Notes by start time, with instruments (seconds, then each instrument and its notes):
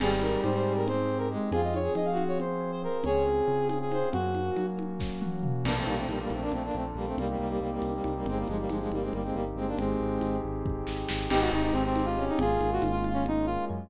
0.00 synth bass 1 G#1, brass section G3 G#4, electric piano 1 C4, pad 2 (warm) C4 D#4 G4 G#4, crash, low conga
0.21 electric piano 1 D#4, brass section A#4, high conga
0.42 synth bass 1 G#2, electric piano 1 G4, brass section C5, tambourine, high conga
0.55 brass section C5
0.65 electric piano 1 G#4
0.77 brass section A#4
0.87 electric piano 1 C4, brass section C4 C5, low conga
1.09 electric piano 1 D#4
1.18 brass section A#4
1.31 brass section G#3, electric piano 1 G4
1.51 synth bass 1 F2, pad 2 (warm) C4 F4 G#4, electric piano 1 C4, brass section F4 G#4, low conga
1.64 brass section D#5
1.74 electric piano 1 F4, brass section C#5, high conga
1.83 brass section G#4
1.95 synth bass 1 F3, electric piano 1 G#4, brass section D#5, tambourine, high conga
2.05 brass section F5
2.11 brass section F#4
2.17 electric piano 1 C4, high conga
2.28 brass section C#5
2.38 electric piano 1 F4, brass section C5, low conga
2.61 electric piano 1 G#4
2.72 brass section C5
2.83 electric piano 1 C4, brass section A#4
3.04 synth bass 1 C#2, pad 2 (warm) C4 C#4 F4 G#4, electric piano 1 C4, brass section G#4 C#5, low conga
3.25 electric piano 1 C#4
3.48 synth bass 1 C#3, electric piano 1 F4
3.68 brass section G#4, electric piano 1 G#4, tambourine, high conga
3.81 brass section G#4
3.91 electric piano 1 C4, brass section C5, high conga
4.12 synth bass 1 F#2, electric piano 1 A#3, pad 2 (warm) A#3 C#4 F#4, brass section F#4, low conga
4.35 electric piano 1 C#4, high conga
4.56 synth bass 1 F#3, electric piano 1 F#4, tambourine, high conga
4.77 electric piano 1 A#3, high conga
5.00 electric piano 1 C#4, kick, snare
5.21 electric piano 1 F#4, high tom
5.43 electric piano 1 A#3, mid tom
5.63 synth bass 1 A#1, brass section A#3 D4, pad 2 (warm) A#3 D4 F4 A4, crash, low conga
5.77 brass section A3 C4
5.86 synth bass 1 A#1, brass section G3 A#3, high conga
5.97 brass section A3 C4
6.08 synth bass 1 A#1, brass section G3 A#3, tambourine, high conga
6.21 brass section G3 A#3
6.30 synth bass 1 A#1, brass section A3 C4, high conga
6.41 brass section A#3 D4
6.52 synth bass 1 A#1, brass section A3 C4, low conga
6.65 brass section A#3 D4
6.74 synth bass 1 A#1, brass section A3 C4
6.95 synth bass 1 A#1, brass section G3 A#3
7.06 brass section A3 C4
7.17 synth bass 1 C2, brass section G3 A#3, pad 2 (warm) A#3 C4 D#4 G4, low conga
7.29 brass section G3 A#3
7.38 synth bass 1 C2, brass section G3 A#3
7.49 brass section G3 A#3
7.60 synth bass 1 C2, brass section G3 A#3
7.72 brass section G3 A#3
7.82 synth bass 1 C2, tambourine, high conga
7.94 brass section G3 A#3
8.04 synth bass 1 C2, high conga
8.16 brass section G3 A#3
8.26 synth bass 1 G1, brass section G#3 C4, pad 2 (warm) A#3 C4 D#4 G4, low conga
8.37 brass section G3 A#3
8.47 synth bass 1 G1, brass section F3 G#3, high conga
8.59 brass section G3 A#3
8.69 synth bass 1 G1, brass section F3 G#3, tambourine, high conga
8.80 brass section F3 G#3
8.91 synth bass 1 G1, brass section G3 A#3, high conga
9.02 brass section G#3 C4
9.12 synth bass 1 G1, brass section G3 A#3, low conga
9.24 brass section G#3 C4
9.33 synth bass 1 G1, brass section G3 A#3
9.56 synth bass 1 G1, brass section G#3 C4
9.67 brass section A#3 D4
9.77 synth bass 1 G#1, brass section G#3 C4, pad 2 (warm) C4 D#4 G4 G#4, low conga
10.00 synth bass 1 G#1
10.21 synth bass 1 G#1, tambourine, high conga
10.44 synth bass 1 G#1
10.65 synth bass 1 G#1, kick
10.87 synth bass 1 G#1, snare
11.09 synth bass 1 G#1, snare
11.29 synth bass 1 G#1, electric piano 1 G#3, pad 2 (warm) G#3 C4 D#4 G4, brass section D#4 G4, crash, low conga
11.41 brass section F#4
11.52 synth bass 1 G#1, electric piano 1 C4, brass section D#4
11.63 brass section D#4
11.73 synth bass 1 G#1, brass section C4, electric piano 1 D#4
11.86 brass section C4
11.96 electric piano 1 G4, tambourine, high conga
12.05 brass section F4
12.17 electric piano 1 G#3, brass section C#4
12.29 brass section D#4
12.39 synth bass 1 G#1, pad 2 (warm) G#3 A#3 C#4 F4, brass section F4 G#4, low conga
12.60 synth bass 1 G#1, electric piano 1 A#3, high conga
12.73 brass section F#4
12.82 synth bass 1 G#1, electric piano 1 C#4, tambourine, high conga
12.92 brass section F4
13.04 electric piano 1 F4, brass section F4, high conga
13.14 brass section C#4
13.25 electric piano 1 G#3, brass section D#4, low conga
13.46 electric piano 1 A#3, brass section F4
13.69 synth bass 1 F#2, electric piano 1 C#4